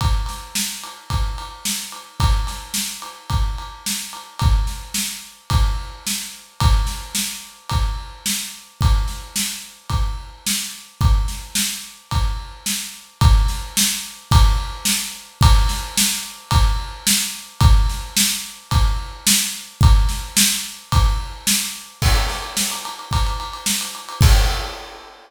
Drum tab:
CC |----------------|----------------|----------------|----------------|
RD |x-x---x-x-x---x-|x-x---x-x-x---x-|x-------x-------|x-------x-------|
SD |--o-o-------o---|--o-o-------o---|--o-o-------o---|--o-o-------o---|
BD |o-------o-------|o-------o-------|o-------o-------|o-------o-------|

CC |----------------|----------------|----------------|----------------|
RD |x-------x-------|x-------x-------|x-------x-------|x-------x-------|
SD |--o-o-------o---|--o-o-------o---|--o-o-------o---|--o-o-------o---|
BD |o-------o-------|o-------o-------|o-------o-------|o-------o-------|

CC |----------------|----------------|x---------------|x---------------|
RD |x-------x-------|x-------x-------|-xxx-xxxxxxx-xxx|----------------|
SD |--o-o-------o---|--o-o-------o---|--o-o-------o---|----------------|
BD |o-------o-------|o-------o-------|o-------o-------|o---------------|